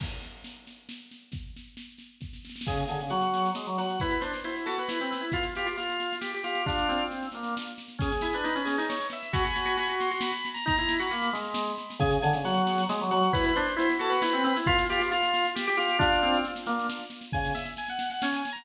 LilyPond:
<<
  \new Staff \with { instrumentName = "Drawbar Organ" } { \time 3/4 \key d \phrygian \tempo 4 = 135 r2. | r2. | gis'16 r16 gis'16 r16 fis'4 r8 fis'8 | b'16 b'16 c''8 c''16 r16 a'16 b'4~ b'16 |
f'16 r16 f'16 r16 f'4 r8 f'8 | <d' f'>4 r2 | \key dis \phrygian gis'8. b'8. gis'8 cis''8 e''8 | <gis'' b''>4. c'''8 b''8. ais''16 |
ais''8. b''8. r4. | \key d \phrygian gis'16 r16 gis''16 r16 fis'4 r8 fis'8 | b'16 b'16 c''8 c''16 r16 a'16 b'4~ b'16 | f'16 r16 f'16 r16 f'4 r8 f'8 |
<d' f'>4 r2 | \key dis \phrygian gis''8 e''16 r16 gis''16 fis''8 fis''16 \tuplet 3/2 { gis''8 gis''8 ais''8 } | }
  \new Staff \with { instrumentName = "Drawbar Organ" } { \time 3/4 \key d \phrygian r2. | r2. | cis8 d16 cis16 fis4 gis16 fis16 fis8 | e'8 d'16 r16 e'8 fis'8 e'16 c'16 c'16 e'16 |
f'8 g'16 f'16 f'4 g'16 g'16 g'8 | d'8 c'4 bes8 r4 | \key dis \phrygian cis'16 r16 e'16 d'16 dis'16 cis'8 dis'8 r8. | fis'16 r16 fis'16 fis'16 fis'16 fis'8 fis'8 r8. |
dis'16 e'8 fis'16 ais8 gis4 r8 | \key d \phrygian cis8 d16 cis16 fis4 gis16 fis16 fis8 | e'8 d'16 r16 e'8 fis'8 e'16 c'16 c'16 e'16 | f'8 g'16 f'16 f'4 g'16 g'16 g'8 |
d'8 c'8 r8 bes8 r4 | \key dis \phrygian cis8 r4. cis'8 r8 | }
  \new DrumStaff \with { instrumentName = "Drums" } \drummode { \time 3/4 <cymc bd sn>8 sn8 sn8 sn8 sn8 sn8 | <bd sn>8 sn8 sn8 sn8 <bd sn>16 sn16 sn32 sn32 sn32 sn32 | <cymc bd sn>16 sn16 sn16 sn16 sn16 sn16 sn16 sn16 sn16 sn16 sn16 sn16 | <bd sn>16 sn16 sn16 sn16 sn16 sn16 sn16 sn16 sn16 sn16 sn16 sn16 |
<bd sn>16 sn16 sn16 sn16 sn16 sn16 sn16 sn16 sn16 sn16 sn16 sn16 | <bd sn>16 sn16 sn16 sn16 sn16 sn16 sn16 sn16 sn16 sn16 sn16 sn16 | <bd sn>16 sn16 sn16 sn16 sn16 sn16 sn16 sn16 sn16 sn16 sn16 sn16 | <bd sn>16 sn16 sn16 sn16 sn16 sn16 sn16 sn16 sn16 sn16 sn16 sn16 |
<bd sn>16 sn16 sn16 sn16 sn16 sn16 sn16 sn16 sn16 sn16 sn16 sn16 | <bd sn>16 sn16 sn16 sn16 sn16 sn16 sn16 sn16 sn16 sn16 sn16 sn16 | <bd sn>16 sn16 sn16 sn16 sn16 sn16 sn16 sn16 sn16 sn16 sn16 sn16 | <bd sn>16 sn16 sn16 sn16 sn16 sn16 sn16 sn16 sn16 sn16 sn16 sn16 |
<bd sn>16 sn16 sn16 sn16 sn16 sn16 sn16 sn16 sn16 sn16 sn16 sn16 | <bd sn>16 sn16 sn16 sn16 sn16 sn16 sn16 sn16 sn16 sn16 sn16 sn16 | }
>>